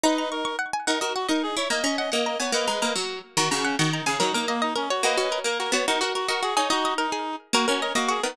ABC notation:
X:1
M:6/8
L:1/8
Q:3/8=144
K:D#phr
V:1 name="Pizzicato Strings"
a a c' c' f g | f d f d2 z | a a f f a g | f a a2 z2 |
a a f f a g | A A d d A c | F F A A F F | F F A d F G |
d d A G2 z | A A d d F A |]
V:2 name="Clarinet"
[Bd]2 A2 z2 | A A F A G c | d d d d d c | [Bd]3 z3 |
F F C F D G | D D A, D C F | [Bd]3 A A c | A A F A G c |
[DF]2 D3 z | F F A F G D |]
V:3 name="Harpsichord"
D4 z2 | D F2 D2 E | A, C2 A,2 B, | A, G, A, F,2 z |
D, C,2 D,2 C, | F, A,4 z | A, C2 A,2 B, | D F2 F2 D |
D3 z3 | A, C2 A,2 B, |]